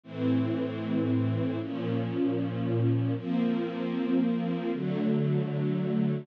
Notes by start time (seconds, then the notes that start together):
0.03 A2 E3 C4
1.59 A#2 F3 C#4
3.16 F3 A#3 C4
4.71 D3 F#3 A3